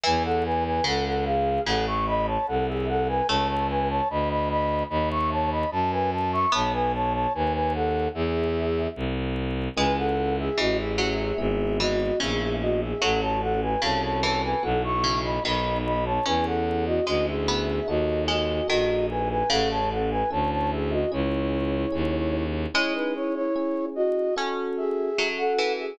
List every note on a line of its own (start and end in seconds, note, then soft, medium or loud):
0.04 0.81 E2 loud
0.04 0.79 E3 medium
0.04 0.23 B4 medium
0.04 0.23 G#5 medium
0.24 0.44 A4 medium
0.24 0.44 F#5 medium
0.45 0.64 B4 medium
0.45 0.64 G#5 medium
0.65 0.84 B4 medium
0.65 0.84 G#5 medium
0.84 1.59 C#2 medium
0.84 1.60 C#3 medium
0.84 1.05 A4 medium
0.84 1.05 F#5 medium
1.06 1.25 A4 medium
1.06 1.25 F#5 medium
1.25 1.61 G#4 medium
1.25 1.61 F5 medium
1.65 2.38 A1 loud
1.65 2.33 C#3 medium
1.65 1.86 A4 medium
1.65 1.86 F#5 medium
1.87 2.06 E5 medium
1.87 2.06 C#6 medium
2.07 2.27 D#5 medium
2.07 2.27 B5 medium
2.27 2.46 C#5 medium
2.27 2.46 A5 medium
2.47 3.22 C2 medium
2.47 2.67 A4 medium
2.47 2.67 F#5 medium
2.68 2.87 G#4 medium
2.68 2.87 E5 medium
2.88 3.08 A4 medium
2.88 3.08 F#5 medium
3.08 3.27 B4 medium
3.08 3.27 G#5 medium
3.28 4.01 C#2 loud
3.28 6.25 A3 loud
3.28 3.48 C#5 medium
3.28 3.48 A5 medium
3.48 3.68 C#5 medium
3.48 3.68 A5 medium
3.69 3.89 B4 medium
3.69 3.89 G#5 medium
3.89 4.08 C#5 medium
3.89 4.08 A5 medium
4.10 4.83 D2 medium
4.10 4.29 D#5 medium
4.10 4.29 B5 medium
4.30 4.49 D#5 medium
4.30 4.49 B5 medium
4.50 4.84 D#5 medium
4.50 4.84 B5 medium
4.90 5.65 D#2 loud
4.90 5.09 D#5 medium
4.90 5.09 B5 medium
5.11 5.30 E5 medium
5.11 5.30 C#6 medium
5.31 5.51 C#5 medium
5.31 5.51 A5 medium
5.51 5.70 D#5 medium
5.51 5.70 B5 medium
5.71 6.46 F#2 medium
5.71 5.91 A5 medium
5.92 6.11 B4 medium
5.92 6.11 G#5 medium
6.12 6.32 A5 medium
6.32 6.52 E5 medium
6.32 6.52 C#6 medium
6.52 7.27 B1 medium
6.52 7.31 B3 loud
6.52 6.73 C#5 medium
6.52 6.73 A5 medium
6.73 6.92 B4 medium
6.73 6.92 G#5 medium
6.94 7.13 C#5 medium
6.94 7.13 A5 medium
7.14 7.33 C#5 medium
7.14 7.33 A5 medium
7.34 8.08 D#2 medium
7.34 7.53 B4 medium
7.34 7.53 G#5 medium
7.54 7.73 B4 medium
7.54 7.73 G#5 medium
7.74 8.08 A4 medium
7.74 8.08 F#5 medium
8.15 8.88 E2 loud
8.15 8.87 G#4 medium
8.15 8.87 E5 medium
8.96 9.69 C2 medium
9.76 10.49 C#2 loud
9.76 10.10 G#3 medium
9.76 10.50 C#4 medium
9.76 10.50 E4 medium
9.76 10.50 G#4 medium
9.76 9.96 B4 medium
9.76 9.96 G#5 medium
9.98 10.36 A4 medium
9.98 10.36 F#5 medium
10.39 10.58 G#4 medium
10.39 10.58 E5 medium
10.58 11.32 A1 medium
10.58 10.97 E3 medium
10.58 11.31 C#4 medium
10.58 11.31 E4 medium
10.58 10.78 F#4 medium
10.58 11.31 G#4 medium
10.58 10.78 D#5 medium
10.78 11.38 G#4 medium
10.78 11.38 E5 medium
10.98 11.70 F#3 medium
11.38 12.11 G#1 medium
11.38 12.11 B3 loud
11.38 12.11 E4 medium
11.38 12.11 G#4 medium
11.38 11.77 G#4 medium
11.38 11.77 E5 medium
11.80 12.17 E3 medium
11.80 12.19 F#4 medium
11.80 12.19 D#5 medium
12.20 12.94 A#1 medium
12.20 12.93 C#3 medium
12.20 12.93 B3 medium
12.20 12.93 E4 medium
12.20 12.93 G#4 medium
12.20 12.54 G#4 medium
12.20 12.54 E5 medium
12.62 12.81 F#4 medium
12.62 12.81 D#5 medium
12.81 13.00 G#4 soft
12.81 13.00 E5 medium
13.01 13.76 A1 medium
13.01 13.38 F#3 loud
13.01 13.74 C#4 medium
13.01 13.74 F#4 medium
13.01 13.20 A4 medium
13.01 13.74 A4 loud
13.01 13.20 F#5 medium
13.22 13.41 C#5 medium
13.22 13.41 A5 medium
13.42 13.61 A4 medium
13.42 13.61 F#5 medium
13.62 13.81 B4 medium
13.62 13.81 G#5 medium
13.81 14.54 C2 medium
13.81 14.20 C#3 medium
13.81 14.56 C#4 medium
13.81 14.56 F#4 medium
13.81 14.56 A4 medium
13.81 14.02 C#5 medium
13.81 14.02 A5 medium
14.03 14.22 C#5 medium
14.03 14.22 A5 medium
14.23 14.96 E3 medium
14.23 14.42 C#5 medium
14.23 14.42 A5 medium
14.44 14.63 B4 medium
14.44 14.63 G#5 medium
14.63 15.39 B1 loud
14.63 15.36 B3 loud
14.63 15.36 E4 loud
14.63 15.36 F#4 loud
14.63 14.82 A4 medium
14.63 14.82 F#5 medium
14.84 15.19 E5 medium
14.84 15.19 C#6 medium
15.04 15.40 C#3 medium
15.24 15.43 D#5 soft
15.24 15.43 B5 medium
15.44 16.19 B1 medium
15.44 16.17 D#3 medium
15.44 16.17 B3 medium
15.44 16.17 D#4 medium
15.44 16.17 F#4 medium
15.44 15.78 D#5 medium
15.44 15.78 B5 medium
15.85 16.05 D#5 medium
15.85 16.05 B5 medium
16.06 16.25 C#5 medium
16.06 16.25 A5 medium
16.26 17.00 E2 medium
16.26 16.60 C#4 loud
16.26 17.00 C#4 medium
16.26 17.00 E4 loud
16.26 17.00 G#4 loud
16.26 16.45 B4 medium
16.26 16.45 G#5 medium
16.46 16.85 A4 medium
16.46 16.85 F#5 medium
16.86 17.06 F#4 medium
16.86 17.06 D#5 medium
17.06 17.80 D2 medium
17.06 17.46 G#3 medium
17.06 17.79 C#4 medium
17.06 17.79 E4 medium
17.06 17.26 F#4 medium
17.06 17.79 G#4 medium
17.06 17.26 D#5 medium
17.27 17.86 G#4 medium
17.27 17.86 E5 medium
17.48 18.26 B3 loud
17.88 18.61 D#2 medium
17.88 18.61 D#4 medium
17.88 18.61 F#4 loud
17.88 18.24 F#4 medium
17.88 18.61 A4 loud
17.88 18.24 D#5 medium
18.28 18.67 G#3 medium
18.28 18.67 F#4 soft
18.28 18.67 D#5 medium
18.68 19.43 A#1 medium
18.68 19.35 D#3 medium
18.68 19.41 D#4 medium
18.68 19.41 F#4 medium
18.68 19.06 F#4 medium
18.68 19.41 A4 medium
18.68 19.06 D#5 medium
19.10 19.29 B4 medium
19.10 19.29 G#5 medium
19.30 19.49 B4 medium
19.30 19.49 G#5 medium
19.50 20.23 A1 medium
19.50 20.23 C#3 loud
19.50 20.23 C#4 loud
19.50 20.23 E4 medium
19.50 19.69 A4 medium
19.50 20.23 A4 medium
19.50 19.69 F#5 medium
19.70 19.90 C#5 medium
19.70 19.90 A5 medium
19.91 20.10 A4 soft
19.91 20.10 F#5 medium
20.11 20.30 B4 medium
20.11 20.30 G#5 medium
20.30 21.05 D2 medium
20.30 21.03 C#4 medium
20.30 21.03 E4 medium
20.30 21.03 A4 medium
20.30 20.50 C#5 medium
20.30 20.50 A5 medium
20.52 20.71 C#5 medium
20.52 20.71 A5 medium
20.72 20.91 G#4 medium
20.72 20.91 E5 medium
20.92 21.11 F#4 soft
20.92 21.11 D#5 medium
21.12 21.85 C#2 medium
21.12 21.85 C#4 medium
21.12 21.85 E4 loud
21.12 22.43 E4 medium
21.12 21.85 G#4 loud
21.12 22.43 C#5 medium
21.92 22.66 D#2 medium
21.92 22.65 C#4 medium
21.92 22.65 E4 medium
21.92 22.65 G#4 medium
22.74 24.18 G#3 loud
22.74 23.47 C#4 loud
22.74 22.94 E4 medium
22.74 23.47 E4 loud
22.74 23.47 G#4 loud
22.74 22.94 C#5 medium
22.95 23.14 D#4 medium
22.95 23.14 B4 medium
23.15 23.35 E4 medium
23.15 23.35 C#5 medium
23.35 23.85 E4 medium
23.35 23.85 C#5 medium
23.56 24.29 C#4 medium
23.56 24.29 E4 medium
23.56 24.29 G#4 medium
23.95 24.34 F#4 medium
23.95 24.34 D#5 medium
24.36 25.09 C#4 loud
24.36 25.12 C#4 medium
24.36 25.09 F#4 loud
24.36 25.09 A4 loud
24.77 25.27 G#4 medium
24.77 25.27 E5 medium
25.18 25.53 F#3 medium
25.18 25.92 C#4 medium
25.18 25.92 F#4 medium
25.18 25.92 A4 medium
25.38 25.73 A4 medium
25.38 25.73 F#5 medium
25.59 25.96 E3 medium
25.79 25.98 G#4 medium
25.79 25.98 E5 medium